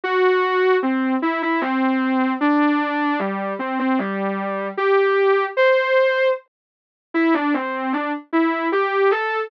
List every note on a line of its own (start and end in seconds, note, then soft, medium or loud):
0.03 0.76 F#4 loud
0.82 1.14 C4 medium
1.22 1.41 E4 medium
1.42 1.61 E4 medium
1.61 2.32 C4 medium
2.40 3.18 D4 loud
3.19 3.53 G3 medium
3.59 3.78 C4 medium
3.79 3.98 C4 medium
3.99 4.67 G3 medium
4.77 5.44 G4 medium
5.57 6.27 C5 medium
7.14 7.33 E4 medium
7.34 7.53 D4 medium
7.54 7.92 C4 medium
7.93 8.12 D4 medium
8.32 8.68 E4 medium
8.72 9.11 G4 medium
9.11 9.49 A4 medium